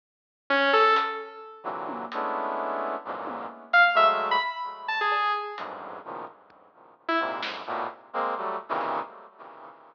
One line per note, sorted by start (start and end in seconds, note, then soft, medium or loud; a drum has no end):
0.50 0.71 C#4 loud
0.73 0.94 A4 loud
0.96 closed hi-hat loud
1.64 2.05 A#2 medium
1.64 2.05 C3 medium
1.64 2.05 D3 medium
1.64 2.05 E3 medium
1.64 2.05 F#3 medium
1.89 high tom loud
2.12 2.96 G#3 medium
2.12 2.96 A3 medium
2.12 2.96 B3 medium
2.12 2.96 C#4 medium
2.12 2.96 D4 medium
2.12 2.96 E4 medium
2.12 closed hi-hat medium
3.05 3.46 E2 medium
3.05 3.46 F2 medium
3.05 3.46 F#2 medium
3.05 3.46 G#2 medium
3.05 3.46 A#2 medium
3.27 high tom medium
3.73 3.84 F5 loud
3.73 closed hi-hat medium
3.95 4.36 F#3 medium
3.95 4.36 G#3 medium
3.95 4.36 A3 medium
3.95 4.07 E5 medium
4.31 4.42 B5 loud
4.88 4.99 A5 medium
5.01 5.32 G#4 medium
5.12 cowbell loud
5.58 5.99 E2 medium
5.58 5.99 F2 medium
5.58 5.99 F#2 medium
5.58 5.99 G2 medium
5.58 5.99 G#2 medium
5.58 closed hi-hat medium
6.04 6.25 A2 soft
6.04 6.25 A#2 soft
6.04 6.25 B2 soft
6.04 6.25 C#3 soft
6.04 6.25 D#3 soft
6.04 6.25 F3 soft
6.27 kick medium
6.50 kick medium
7.08 7.19 E4 medium
7.20 7.40 G#2 medium
7.20 7.41 A#2 medium
7.20 7.41 C3 medium
7.41 7.62 F2 medium
7.41 7.62 F#2 medium
7.41 7.62 G#2 medium
7.41 snare loud
7.67 7.87 A2 loud
7.67 7.87 A#2 loud
7.67 7.87 B2 loud
8.13 8.34 G#3 loud
8.13 8.34 A#3 loud
8.13 8.34 C4 loud
8.36 8.57 F#3 medium
8.36 8.57 G3 medium
8.36 8.57 A3 medium
8.69 9.00 A#2 loud
8.69 9.00 C3 loud
8.69 9.00 C#3 loud
8.69 9.00 D#3 loud
8.69 9.00 E3 loud
8.81 closed hi-hat medium